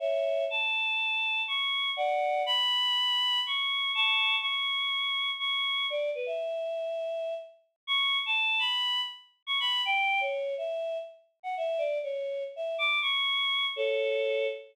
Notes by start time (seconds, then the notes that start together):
0.00 C#5 E5
0.50 A5
1.48 C#6
1.97 D5 F#5
2.46 B5
3.47 C#6
3.95 A5 C#6
4.41 C#6
5.39 C#6
5.90 D5
6.15 B4
6.26 E5
7.87 C#6
8.26 A5
8.59 B5
9.47 C#6
9.60 B5
9.85 G5
10.21 C#5
10.58 E5
11.43 F#5
11.57 E5
11.78 D5
12.03 C#5
12.56 E5
12.78 D6
13.02 C#6
13.76 A4 C#5